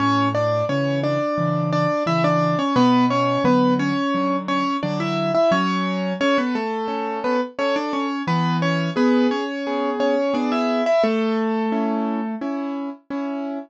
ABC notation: X:1
M:4/4
L:1/16
Q:1/4=87
K:A
V:1 name="Acoustic Grand Piano"
[Cc]2 [Dd]2 [Cc]2 [Dd]4 [Dd]2 [Ee] [Dd]2 [Cc] | [B,B]2 [Cc]2 [B,B]2 [Cc]4 [Cc]2 [Dd] [Ee]2 [Ee] | [Cc]4 [Cc] [B,B] [A,A]4 [B,B] z [Cc] [Dd] [Cc]2 | [B,B]2 [Cc]2 [B,B]2 [Cc]4 [Cc]2 [Dd] [Ee]2 [Ee] |
[A,A]8 z8 |]
V:2 name="Acoustic Grand Piano"
A,,4 [C,E,]4 [C,E,]4 [C,E,]4 | B,,4 [D,F,]4 [D,F,]4 [D,F,]4 | F,4 A4 [CA]4 A4 | E,4 G4 [B,G]4 [B,G]4 |
z4 [CE]4 [CE]4 [CE]4 |]